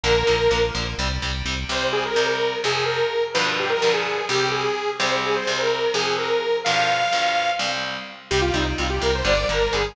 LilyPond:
<<
  \new Staff \with { instrumentName = "Lead 2 (sawtooth)" } { \time 7/8 \key c \minor \tempo 4 = 127 bes'4. r2 | c''16 r16 aes'16 bes'8 bes'8. aes'8 bes'4 | b'16 r16 g'16 bes'8 aes'8. g'8 aes'4 | c''16 r16 aes'16 c''8 bes'8. aes'8 bes'4 |
f''2 r4. | g'16 f'16 ees'16 r16 f'16 g'16 bes'16 c''16 d''8 bes'8 aes'8 | }
  \new Staff \with { instrumentName = "Overdriven Guitar" } { \time 7/8 \key c \minor <d f bes>8 <d f bes>8 <d f bes>8 <d f bes>8 <c g>8 <c g>8 <c g>8 | <c, c g>4 <c, c g>4 <f, c f>4. | <g, b, d f>4 <g, b, d f>4 <c, c g>4. | <c, c g>4 <c, c g>4 <f, c f>4. |
<g, b, d f>4 <g, b, d f>4 <c, c g>4. | <c g>8 <c g>8 <c g>8 <c g>8 <d g>8 <d g>8 <d g>8 | }
  \new Staff \with { instrumentName = "Synth Bass 1" } { \clef bass \time 7/8 \key c \minor bes,,8 bes,,8 bes,,8 bes,,8 c,8 c,8 c,8 | r2. r8 | r2. r8 | r2. r8 |
r2. r8 | c,8 c,8 c,8 c,8 g,,8 g,,8 g,,8 | }
>>